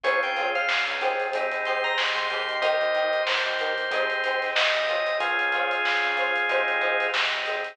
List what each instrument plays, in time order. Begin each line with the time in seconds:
0.03 synth bass 1 C#2, drawbar organ C4 C#4 F4 G#4 C#5, acoustic guitar (steel) F4 G#4 C5 C#5, kick, closed hi-hat
0.23 synth bass 1 C#2, drawbar organ G5, closed hi-hat
0.36 acoustic guitar (steel) F4 G#4 C5 C#5, closed hi-hat
0.55 drawbar organ F5, closed hi-hat
0.68 drawbar organ C4 C#4 F4 G#4, snare
0.87 synth bass 1 C#2, closed hi-hat
1.01 acoustic guitar (steel) D#4 G4 G#4 C5, snare, closed hi-hat
1.19 kick, closed hi-hat
1.33 synth bass 1 G#1, drawbar organ C4 D#4 G4 G#4, kick, closed hi-hat
1.51 synth bass 1 D#2, closed hi-hat
1.65 acoustic guitar (steel) D#4 G4 G#4 C5, drawbar organ C6, closed hi-hat
1.84 drawbar organ A#5, kick, closed hi-hat
1.98 drawbar organ C4 D#4 G4 G#4 C6, snare
2.15 synth bass 1 G#2, drawbar organ C6, kick, closed hi-hat
2.30 synth bass 1 D#2, drawbar organ A#3 D#4 G4, acoustic guitar (steel) D#4 G4 G#4 C5, closed hi-hat
2.49 closed hi-hat
2.62 acoustic guitar (steel) D#4 G4 A#4, drawbar organ C5 D#5, kick, closed hi-hat
2.81 synth bass 1 D#2, closed hi-hat
2.94 acoustic guitar (steel) D#4 G4 A#4, closed hi-hat
3.13 closed hi-hat
3.26 drawbar organ A#3 D#4 G4 C5, snare
3.45 synth bass 1 D#2, closed hi-hat
3.59 acoustic guitar (steel) D#4 G4 A#4, snare, closed hi-hat
3.78 kick, closed hi-hat
3.91 synth bass 1 G#1, drawbar organ C4 D#4 G4 G#4, acoustic guitar (steel) D#4 G4 G#4 C5, kick, closed hi-hat
4.10 synth bass 1 D#2, closed hi-hat
4.24 acoustic guitar (steel) D#4 G4 G#4 C5, closed hi-hat
4.42 snare, closed hi-hat
4.55 drawbar organ C4 D#4 G4 G#4 D#5, snare
4.74 synth bass 1 G#1, kick, closed hi-hat
4.88 acoustic guitar (steel) F4 G#4 C5 C#5, closed hi-hat
5.06 closed hi-hat
5.20 synth bass 1 C#2, drawbar organ C4 C#4 F4 G#4, kick, closed hi-hat
5.39 synth bass 1 C#2, closed hi-hat
5.52 acoustic guitar (steel) F4 G#4 C5 C#5, closed hi-hat
5.71 closed hi-hat
5.84 drawbar organ C4 C#4 F4 G#4, snare
6.03 synth bass 1 C#3, snare, closed hi-hat
6.17 acoustic guitar (steel) F4 G#4 C5 C#5, closed hi-hat
6.35 kick, closed hi-hat
6.49 synth bass 1 G#1, drawbar organ C4 D#4 G4 G#4, acoustic guitar (steel) D#4 G4 G#4 C5, kick, closed hi-hat
6.68 synth bass 1 G#1, closed hi-hat
6.81 acoustic guitar (steel) D#4 G4 G#4 C5, closed hi-hat
7.00 kick, closed hi-hat
7.14 drawbar organ C4 D#4 G4 G#4, snare
7.33 synth bass 1 G#1, closed hi-hat
7.46 acoustic guitar (steel) D#4 G4 G#4 C5, closed hi-hat
7.64 snare, closed hi-hat